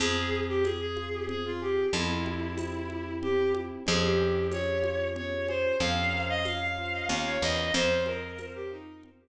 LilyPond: <<
  \new Staff \with { instrumentName = "Violin" } { \time 3/4 \key f \minor \tempo 4 = 93 aes'8. g'16 aes'16 aes'8. aes'16 f'16 g'8 | e'2 g'8 r8 | aes'16 g'8. des''4 des''8 c''8 | f''8. ees''16 f''16 f''8. f''16 des''16 ees''8 |
c''8 bes'8. g'16 ees'8 r4 | }
  \new Staff \with { instrumentName = "Electric Piano 1" } { \time 3/4 \key f \minor c'8 aes'8 c'8 f'8 c'8 aes'8 | c'8 g'8 c'8 e'8 c'8 g'8 | des'8 aes'8 des'8 f'8 des'8 aes'8 | des'8 bes'8 des'8 f'8 des'8 bes'8 |
c'8 aes'8 c'8 f'8 c'8 r8 | }
  \new Staff \with { instrumentName = "Electric Bass (finger)" } { \clef bass \time 3/4 \key f \minor f,2. | f,2. | f,2. | f,2 ees,8 e,8 |
f,2. | }
  \new DrumStaff \with { instrumentName = "Drums" } \drummode { \time 3/4 cgl4 <cgho tamb>8 cgho8 cgl4 | cgl8 cgho8 <cgho tamb>8 cgho8 cgl8 cgho8 | cgl4 <cgho tamb>8 cgho8 cgl8 cgho8 | cgl4 <cgho tamb>4 cgl4 |
cgl8 cgho8 <cgho tamb>4 cgl4 | }
>>